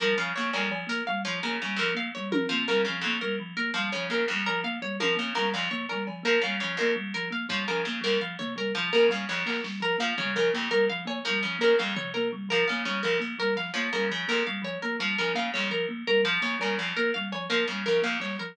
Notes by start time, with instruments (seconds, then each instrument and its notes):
0.00 harpsichord F3, kalimba G3, orchestral harp A#4
0.17 harpsichord C#3, kalimba F3, orchestral harp F5
0.36 harpsichord C#3, kalimba A#3, orchestral harp C#5
0.53 harpsichord F2, kalimba G3, orchestral harp A#4, cowbell
0.70 kalimba F3, cowbell
0.87 kalimba A#3, orchestral harp A#4, closed hi-hat
1.07 kalimba G3, orchestral harp F5
1.25 harpsichord F3, kalimba F3, orchestral harp C#5
1.43 harpsichord C#3, kalimba A#3, orchestral harp A#4
1.62 harpsichord C#3, kalimba G3
1.76 harpsichord F2, kalimba F3, orchestral harp A#4, closed hi-hat
1.94 kalimba A#3, orchestral harp F5
2.15 kalimba G3, orchestral harp C#5
2.31 kalimba F3, orchestral harp A#4, high tom
2.49 harpsichord F3, kalimba A#3, floor tom
2.68 harpsichord C#3, kalimba G3, orchestral harp A#4
2.85 harpsichord C#3, kalimba F3, orchestral harp F5
3.01 harpsichord F2, kalimba A#3, orchestral harp C#5
3.21 kalimba G3, orchestral harp A#4
3.40 kalimba F3
3.57 kalimba A#3, orchestral harp A#4
3.74 harpsichord F3, kalimba G3, orchestral harp F5
3.92 harpsichord C#3, kalimba F3, orchestral harp C#5
4.10 harpsichord C#3, kalimba A#3, orchestral harp A#4
4.28 harpsichord F2, kalimba G3
4.46 kalimba F3, orchestral harp A#4, cowbell
4.64 kalimba A#3, orchestral harp F5
4.82 kalimba G3, orchestral harp C#5
5.00 harpsichord F3, kalimba F3, orchestral harp A#4, high tom
5.16 harpsichord C#3, kalimba A#3
5.35 harpsichord C#3, kalimba G3, orchestral harp A#4
5.53 harpsichord F2, kalimba F3, orchestral harp F5, cowbell
5.71 kalimba A#3, orchestral harp C#5, floor tom
5.89 kalimba G3, orchestral harp A#4, cowbell
6.07 kalimba F3, cowbell
6.23 harpsichord F3, kalimba A#3, orchestral harp A#4
6.42 harpsichord C#3, kalimba G3, orchestral harp F5
6.60 harpsichord C#3, kalimba F3, orchestral harp C#5
6.77 harpsichord F2, kalimba A#3, orchestral harp A#4
6.96 kalimba G3
7.14 kalimba F3, orchestral harp A#4, kick
7.31 kalimba A#3, orchestral harp F5
7.49 harpsichord F3, kalimba G3, orchestral harp C#5, kick
7.68 harpsichord C#3, kalimba F3, orchestral harp A#4, kick
7.85 harpsichord C#3, kalimba A#3
8.01 harpsichord F2, kalimba G3, orchestral harp A#4, kick
8.21 kalimba F3, orchestral harp F5
8.39 kalimba A#3, orchestral harp C#5, floor tom
8.56 kalimba G3, orchestral harp A#4, cowbell
8.75 harpsichord F3, kalimba F3
8.93 harpsichord C#3, kalimba A#3, orchestral harp A#4, snare
9.09 harpsichord C#3, kalimba G3, orchestral harp F5, kick
9.29 harpsichord F2, kalimba F3, orchestral harp C#5
9.46 kalimba A#3, orchestral harp A#4, clap
9.64 kalimba G3, snare
9.80 kalimba F3, orchestral harp A#4
9.98 harpsichord F3, kalimba A#3, orchestral harp F5
10.18 harpsichord C#3, kalimba G3, orchestral harp C#5, floor tom
10.35 harpsichord C#3, kalimba F3, orchestral harp A#4
10.53 harpsichord F2, kalimba A#3
10.71 kalimba G3, orchestral harp A#4
10.90 kalimba F3, orchestral harp F5
11.05 kalimba A#3, orchestral harp C#5, cowbell
11.25 harpsichord F3, kalimba G3, orchestral harp A#4
11.43 harpsichord C#3, kalimba F3
11.58 harpsichord C#3, kalimba A#3, orchestral harp A#4
11.79 harpsichord F2, kalimba G3, orchestral harp F5
11.95 kalimba F3, orchestral harp C#5, floor tom
12.14 kalimba A#3, orchestral harp A#4
12.33 kalimba G3
12.49 kalimba F3, harpsichord F3, orchestral harp A#4
12.68 harpsichord C#3, kalimba A#3, orchestral harp F5
12.85 harpsichord C#3, kalimba G3, orchestral harp C#5
13.03 harpsichord F2, kalimba F3, orchestral harp A#4, floor tom
13.20 kalimba A#3, closed hi-hat
13.39 kalimba G3, orchestral harp A#4, kick
13.56 kalimba F3, orchestral harp F5, clap
13.74 harpsichord F3, kalimba A#3, orchestral harp C#5
13.93 harpsichord C#3, kalimba G3, orchestral harp A#4
14.10 harpsichord C#3, kalimba F3
14.28 harpsichord F2, kalimba A#3, orchestral harp A#4
14.47 kalimba G3, orchestral harp F5
14.62 kalimba F3, orchestral harp C#5, cowbell
14.82 kalimba A#3, orchestral harp A#4
14.99 harpsichord F3, kalimba G3
15.18 harpsichord C#3, kalimba F3, orchestral harp A#4
15.35 harpsichord C#3, kalimba A#3, orchestral harp F5
15.54 harpsichord F2, kalimba G3, orchestral harp C#5, clap
15.70 kalimba F3, orchestral harp A#4
15.89 kalimba A#3
16.07 kalimba G3, orchestral harp A#4
16.23 kalimba F3, harpsichord F3, orchestral harp F5
16.42 harpsichord C#3, kalimba A#3, orchestral harp C#5
16.60 harpsichord C#3, kalimba G3, orchestral harp A#4, cowbell
16.78 harpsichord F2, kalimba F3, cowbell
16.97 kalimba A#3, orchestral harp A#4
17.14 kalimba G3, orchestral harp F5
17.32 kalimba F3, orchestral harp C#5, cowbell
17.50 harpsichord F3, kalimba A#3, orchestral harp A#4, closed hi-hat
17.68 harpsichord C#3, kalimba G3
17.86 harpsichord C#3, kalimba F3, orchestral harp A#4
18.02 harpsichord F2, kalimba A#3, orchestral harp F5
18.20 kalimba G3, orchestral harp C#5, clap
18.39 kalimba F3, orchestral harp A#4